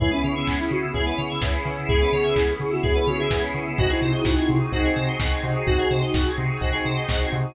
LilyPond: <<
  \new Staff \with { instrumentName = "Ocarina" } { \time 4/4 \key cis \minor \tempo 4 = 127 e'16 cis'8 cis'8 e'16 fis'16 r2 r16 | gis'4. gis'16 fis'16 gis'8 fis'16 gis'8 r8. | fis'16 e'8 e'8 e'16 e'16 r2 r16 | fis'4. r2 r8 | }
  \new Staff \with { instrumentName = "Electric Piano 1" } { \time 4/4 \key cis \minor <b cis' e' gis'>16 <b cis' e' gis'>4.~ <b cis' e' gis'>16 <b cis' e' gis'>16 <b cis' e' gis'>8. <b cis' e' gis'>8 <b cis' e' gis'>8~ | <b cis' e' gis'>16 <b cis' e' gis'>4.~ <b cis' e' gis'>16 <b cis' e' gis'>16 <b cis' e' gis'>8. <b cis' e' gis'>8 <b cis' e' gis'>8 | <bis dis' fis' gis'>16 <bis dis' fis' gis'>4.~ <bis dis' fis' gis'>16 <bis dis' fis' gis'>16 <bis dis' fis' gis'>8. <bis dis' fis' gis'>8 <bis dis' fis' gis'>8~ | <bis dis' fis' gis'>16 <bis dis' fis' gis'>4.~ <bis dis' fis' gis'>16 <bis dis' fis' gis'>16 <bis dis' fis' gis'>8. <bis dis' fis' gis'>8 <bis dis' fis' gis'>8 | }
  \new Staff \with { instrumentName = "Electric Piano 2" } { \time 4/4 \key cis \minor gis'16 b'16 cis''16 e''16 gis''16 b''16 cis'''16 e'''16 gis'16 b'16 cis''16 e''16 gis''16 b''16 cis'''16 e'''16 | gis'16 b'16 cis''16 e''16 gis''16 b''16 cis'''16 e'''16 gis'16 b'16 cis''16 e''16 gis''16 b''16 cis'''16 e'''16 | fis'16 gis'16 bis'16 dis''16 fis''16 gis''16 bis''16 dis'''16 fis'16 gis'16 bis'16 dis''16 fis''16 gis''16 bis''16 dis'''16 | fis'16 gis'16 bis'16 dis''16 fis''16 gis''16 bis''16 dis'''16 fis'16 gis'16 bis'16 dis''16 fis''16 gis''16 bis''16 dis'''16 | }
  \new Staff \with { instrumentName = "Synth Bass 2" } { \clef bass \time 4/4 \key cis \minor cis,8 cis8 cis,8 cis8 cis,8 cis8 cis,8 cis8 | cis,8 cis8 cis,8 cis8 cis,8 cis8 cis,8 cis8 | bis,,8 bis,8 bis,,8 bis,8 bis,,8 bis,8 bis,,8 bis,8 | bis,,8 bis,8 bis,,8 bis,8 bis,,8 bis,8 bis,,8 bis,8 | }
  \new Staff \with { instrumentName = "Pad 5 (bowed)" } { \time 4/4 \key cis \minor <b cis' e' gis'>1~ | <b cis' e' gis'>1 | <bis dis' fis' gis'>1~ | <bis dis' fis' gis'>1 | }
  \new DrumStaff \with { instrumentName = "Drums" } \drummode { \time 4/4 <hh bd>8 hho8 <hc bd>8 hho8 <hh bd>8 hho8 <bd sn>8 hho8 | <hh bd>8 hho8 <hc bd>8 hho8 <hh bd>8 hho8 <bd sn>8 hho8 | <hh bd>8 hho8 <bd sn>8 hho8 <hh bd>8 hho8 <bd sn>8 hho8 | <hh bd>8 hho8 <bd sn>8 hho8 <hh bd>8 hho8 <bd sn>8 hho8 | }
>>